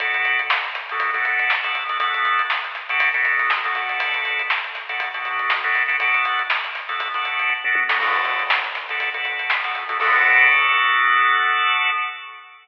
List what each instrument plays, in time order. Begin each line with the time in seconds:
0.00 drawbar organ B3 D4 F#4 A4, kick, closed hi-hat
0.14 closed hi-hat
0.25 closed hi-hat
0.39 closed hi-hat
0.50 snare
0.64 closed hi-hat
0.75 snare, closed hi-hat
0.89 drawbar organ B3 D4 F#4 A4, snare, closed hi-hat
1.00 kick, closed hi-hat
1.13 drawbar organ B3 D4 F#4 A4, snare, closed hi-hat
1.25 kick, closed hi-hat
1.39 closed hi-hat
1.50 snare
1.64 drawbar organ B3 D4 F#4 A4, closed hi-hat
1.75 closed hi-hat
1.89 drawbar organ B3 D4 F#4 A4, closed hi-hat
2.00 drawbar organ B3 D4 F#4 A4, kick, closed hi-hat
2.14 closed hi-hat
2.25 closed hi-hat
2.39 closed hi-hat
2.50 snare
2.64 closed hi-hat
2.75 snare, closed hi-hat
2.89 drawbar organ B3 D4 F#4 A4, closed hi-hat
3.00 kick, closed hi-hat
3.13 drawbar organ B3 D4 F#4 A4, kick, closed hi-hat
3.25 closed hi-hat
3.39 snare, closed hi-hat
3.50 snare
3.64 drawbar organ B3 D4 F#4 A4, closed hi-hat
3.75 drawbar organ B3 D4 F#4 A4, closed hi-hat
3.89 snare, closed hi-hat
4.00 kick, closed hi-hat
4.14 closed hi-hat
4.25 closed hi-hat
4.39 closed hi-hat
4.50 snare
4.64 closed hi-hat
4.75 snare, closed hi-hat
4.89 drawbar organ B3 D4 F#4 A4, closed hi-hat
5.00 kick, closed hi-hat
5.14 drawbar organ B3 D4 F#4 A4, kick, closed hi-hat
5.25 kick, closed hi-hat
5.39 closed hi-hat
5.50 snare
5.64 drawbar organ B3 D4 F#4 A4, closed hi-hat
5.75 closed hi-hat
5.88 drawbar organ B3 D4 F#4 A4, closed hi-hat
6.00 drawbar organ B3 D4 F#4 A4, kick, closed hi-hat
6.14 closed hi-hat
6.25 closed hi-hat
6.39 closed hi-hat
6.50 snare
6.64 closed hi-hat
6.75 snare, closed hi-hat
6.88 drawbar organ B3 D4 F#4 A4, closed hi-hat
7.00 kick, closed hi-hat
7.14 drawbar organ B3 D4 F#4 A4, kick, closed hi-hat
7.25 kick, closed hi-hat
7.39 closed hi-hat
7.50 kick, floor tom
7.64 drawbar organ B3 D4 F#4 A4, mid tom
7.75 high tom
7.88 drawbar organ B3 D4 F#4 A4, snare
8.00 drawbar organ B3 D4 F#4 A4, kick, crash
8.14 closed hi-hat
8.25 snare, closed hi-hat
8.39 closed hi-hat
8.50 snare
8.64 closed hi-hat
8.75 snare, closed hi-hat
8.89 drawbar organ B3 D4 F#4 A4, closed hi-hat
9.00 kick, closed hi-hat
9.14 drawbar organ B3 D4 F#4 A4, kick, closed hi-hat
9.25 kick, closed hi-hat
9.39 closed hi-hat
9.50 snare
9.64 drawbar organ B3 D4 F#4 A4, snare, closed hi-hat
9.75 snare, closed hi-hat
9.88 drawbar organ B3 D4 F#4 A4, snare, closed hi-hat
10.00 drawbar organ B3 D4 F#4 A4, kick, crash